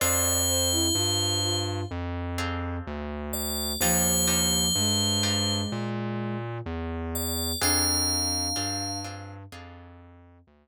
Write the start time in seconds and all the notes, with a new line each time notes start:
0.00 F2 C4 D4 F4 G#4 C5 D5
0.48 C5
0.72 E4
0.95 G2 F4
1.43 F4
1.91 F2
2.38 C4 D4 F4 G#4
2.87 D2
3.33 D5
3.81 D#2 F3 D4 D#4 F4 G4 C5
4.27 D4 D#4 F4 G4
4.76 G2 G#3
5.23 D4 D#4 F4 G4
5.72 A#2
6.66 E2
7.15 D5
7.62 F2 C4 D4 F4 G#4 F5
8.56 G2 C4 D4 F4 G#4
9.04 C4 D4 F4 G#4
9.52 F2 C4 D4 F4 G#4
10.47 D2